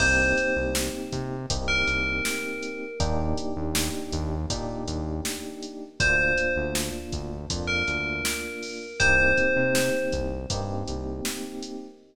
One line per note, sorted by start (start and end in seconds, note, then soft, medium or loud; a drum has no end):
0.00 0.34 C2 medium
0.00 1.35 A#3 loud
0.00 1.35 C4 loud
0.00 1.35 D#4 loud
0.00 1.35 G4 loud
0.00 0.55 C5 loud
0.00 kick loud
0.00 crash loud
0.38 closed hi-hat medium
0.56 0.90 C2 medium
0.75 snare loud
1.12 1.46 C3 medium
1.12 kick medium
1.12 closed hi-hat medium
1.50 1.84 C2 medium
1.50 2.85 A#3 medium
1.50 2.85 C4 medium
1.50 2.85 D#4 medium
1.50 2.85 G4 medium
1.50 kick loud
1.50 closed hi-hat loud
1.68 2.87 A#4 loud
1.88 2.21 C2 medium
1.88 closed hi-hat medium
2.25 snare loud
2.62 closed hi-hat medium
3.00 3.34 D#2 medium
3.00 4.35 A#3 loud
3.00 4.35 D4 loud
3.00 4.35 D#4 loud
3.00 4.35 G4 loud
3.00 kick loud
3.00 closed hi-hat loud
3.38 closed hi-hat medium
3.56 3.90 D#2 medium
3.75 snare loud
4.12 4.46 D#2 medium
4.12 kick medium
4.12 closed hi-hat medium
4.50 4.84 A#2 medium
4.50 5.85 A#3 medium
4.50 5.85 D4 medium
4.50 5.85 D#4 medium
4.50 5.85 G4 medium
4.50 kick loud
4.50 closed hi-hat loud
4.88 5.21 D#2 medium
4.88 closed hi-hat medium
5.25 snare loud
5.62 closed hi-hat medium
6.00 6.34 D2 medium
6.00 7.35 A#3 loud
6.00 7.35 D4 loud
6.00 7.35 F4 loud
6.00 6.52 C5 loud
6.00 kick loud
6.00 closed hi-hat loud
6.38 closed hi-hat medium
6.56 6.90 D2 medium
6.75 snare loud
7.12 7.46 D2 medium
7.12 kick medium
7.12 closed hi-hat medium
7.50 7.84 F2 medium
7.50 8.85 A#3 medium
7.50 8.85 D4 medium
7.50 8.85 F4 medium
7.50 kick medium
7.50 closed hi-hat loud
7.68 8.96 A#4 medium
7.88 8.21 D2 medium
7.88 closed hi-hat medium
8.25 snare loud
8.62 open hi-hat medium
9.00 9.34 C2 medium
9.00 10.35 A#3 loud
9.00 10.35 C4 loud
9.00 10.35 D#4 loud
9.00 10.35 G4 loud
9.00 10.04 C5 loud
9.00 kick loud
9.00 closed hi-hat loud
9.37 kick medium
9.37 closed hi-hat medium
9.56 9.90 C3 medium
9.75 snare loud
10.12 10.46 C2 medium
10.12 kick medium
10.12 closed hi-hat medium
10.50 10.84 G2 medium
10.50 11.85 A#3 loud
10.50 11.85 C4 loud
10.50 11.85 D#4 medium
10.50 11.85 G4 loud
10.50 kick medium
10.50 closed hi-hat loud
10.88 11.21 C2 medium
10.88 closed hi-hat medium
11.25 snare loud
11.62 closed hi-hat medium